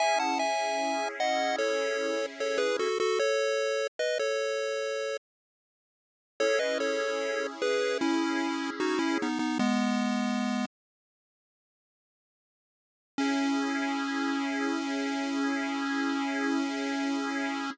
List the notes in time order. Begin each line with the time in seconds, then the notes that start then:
0.00 C#4 E4 G#4 E5 G#5
0.20 F#5 A5
0.39 E5 G#5
1.20 D#5 F#5
1.58 A4 C#5
2.40 A4 C#5
2.58 G#4 B4
2.79 F#4 A4
3.00 F#4 A4
3.19 A4 C#5
3.99 B4 D#5
4.19 A4 C#5
6.40 C#4 E4 G#4 A4 C#5
6.59 B4 D#5
6.80 A4 C#5
7.62 G#4 B4
8.01 C#4 E4
8.80 D#4 F#4
8.99 C#4 E4
9.22 B3 D#4
9.39 B3 D#4
9.59 G#3 B3
13.18 C#4 E4 G#4